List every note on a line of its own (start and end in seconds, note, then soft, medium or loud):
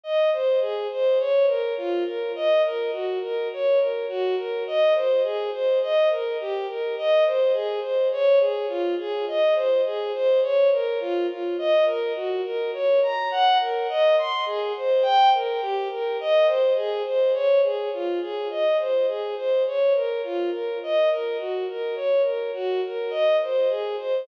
0.03 0.30 D#5 medium
0.33 0.59 C5 medium
0.61 0.87 G#4 medium
0.92 1.18 C5 medium
1.19 1.45 C#5 medium
1.47 1.74 A#4 medium
1.77 2.03 F4 medium
2.06 2.32 A#4 medium
2.35 2.62 D#5 medium
2.64 2.91 A#4 medium
2.92 3.19 F#4 medium
3.22 3.48 A#4 medium
3.53 3.79 C#5 medium
3.79 4.06 A#4 medium
4.09 4.35 F#4 medium
4.37 4.63 A#4 medium
4.67 4.94 D#5 medium
4.95 5.22 C5 medium
5.23 5.50 G#4 medium
5.52 5.79 C5 medium
5.82 6.09 D#5 medium
6.11 6.37 A#4 medium
6.40 6.66 G4 medium
6.68 6.95 A#4 medium
6.97 7.24 D#5 medium
7.26 7.52 C5 medium
7.53 7.80 G#4 medium
7.81 8.08 C5 medium
8.12 8.38 C#5 medium
8.40 8.66 G#4 medium
8.68 8.95 F4 medium
8.99 9.25 G#4 medium
9.28 9.54 D#5 medium
9.55 9.81 C5 medium
9.86 10.12 G#4 medium
10.14 10.40 C5 medium
10.42 10.69 C#5 medium
10.72 10.99 A#4 medium
11.00 11.26 F4 medium
11.29 11.56 F4 medium
11.58 11.85 D#5 medium
11.86 12.12 A#4 medium
12.15 12.41 F#4 medium
12.44 12.71 A#4 medium
12.73 13.00 C#5 medium
13.02 13.29 A#5 medium
13.31 13.58 F#5 medium
13.61 13.87 A#4 medium
13.89 14.16 D#5 medium
14.18 14.45 C6 medium
14.46 14.72 G#4 medium
14.77 15.04 C5 medium
15.02 15.29 G5 medium
15.34 15.60 A#4 medium
15.62 15.88 G4 medium
15.91 16.18 A#4 medium
16.20 16.47 D#5 medium
16.47 16.73 C5 medium
16.76 17.03 G#4 medium
17.06 17.32 C5 medium
17.33 17.60 C#5 medium
17.63 17.89 G#4 medium
17.93 18.19 F4 medium
18.22 18.48 G#4 medium
18.50 18.77 D#5 medium
18.79 19.06 C5 medium
19.08 19.35 G#4 medium
19.36 19.63 C5 medium
19.66 19.93 C#5 medium
19.95 20.21 A#4 medium
20.24 20.50 F4 medium
20.52 20.78 A#4 medium
20.83 21.09 D#5 medium
21.11 21.37 A#4 medium
21.38 21.65 F#4 medium
21.69 21.95 A#4 medium
21.95 22.22 C#5 medium
22.24 22.51 A#4 medium
22.54 22.80 F#4 medium
22.85 23.12 A#4 medium
23.10 23.37 D#5 medium
23.43 23.69 C5 medium
23.69 23.96 G#4 medium
23.98 24.25 C5 medium